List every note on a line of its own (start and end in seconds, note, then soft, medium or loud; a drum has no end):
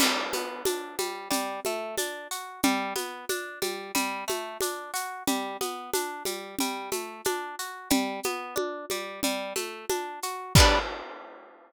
0.00 0.30 G3 medium
0.00 crash loud
0.00 low conga medium
0.00 shaker medium
0.33 0.63 B3 medium
0.33 high conga medium
0.33 shaker medium
0.65 0.96 D4 medium
0.65 high conga medium
0.65 shaker medium
0.99 1.28 G3 medium
0.99 high conga medium
0.99 shaker medium
1.30 1.60 G3 medium
1.30 low conga medium
1.30 shaker medium
1.65 1.95 A3 medium
1.65 high conga medium
1.65 shaker medium
1.98 2.28 D4 medium
1.98 high conga medium
1.98 shaker medium
2.31 2.61 F#4 medium
2.31 shaker medium
2.63 2.94 G3 medium
2.63 low conga medium
2.63 shaker medium
2.96 3.25 B3 medium
2.96 high conga medium
2.96 shaker medium
3.29 3.59 D4 medium
3.29 high conga medium
3.29 shaker medium
3.62 3.92 G3 medium
3.62 high conga medium
3.62 shaker medium
3.95 4.24 G3 medium
3.95 low conga medium
3.95 shaker medium
4.28 4.58 A3 medium
4.28 high conga medium
4.28 shaker medium
4.61 4.91 D4 medium
4.61 high conga medium
4.61 shaker medium
4.94 5.23 F#4 medium
4.94 shaker medium
5.27 5.57 G3 medium
5.27 low conga medium
5.27 shaker medium
5.61 5.91 B3 medium
5.61 high conga medium
5.61 shaker medium
5.93 6.23 D4 medium
5.93 high conga medium
5.93 shaker medium
6.25 6.56 G3 medium
6.25 high conga medium
6.25 shaker medium
6.59 6.90 G3 medium
6.59 low conga medium
6.59 shaker medium
6.92 7.21 A3 medium
6.92 high conga medium
6.92 shaker medium
7.25 7.55 D4 medium
7.25 high conga medium
7.25 shaker medium
7.59 7.89 F#4 medium
7.59 shaker medium
7.90 8.20 G3 medium
7.90 low conga loud
7.90 shaker medium
8.23 8.55 B3 medium
8.23 high conga medium
8.23 shaker medium
8.56 8.86 D4 medium
8.56 high conga medium
8.90 9.21 G3 medium
8.90 high conga medium
8.90 shaker medium
9.23 9.53 G3 medium
9.23 low conga medium
9.23 shaker medium
9.56 9.85 A3 medium
9.56 high conga medium
9.56 shaker medium
9.89 10.20 D4 medium
9.89 high conga medium
9.89 shaker medium
10.23 10.53 F#4 medium
10.23 shaker medium
10.55 10.79 G3 loud
10.55 10.79 B3 loud
10.55 kick loud
10.55 crash loud
10.60 10.79 D4 loud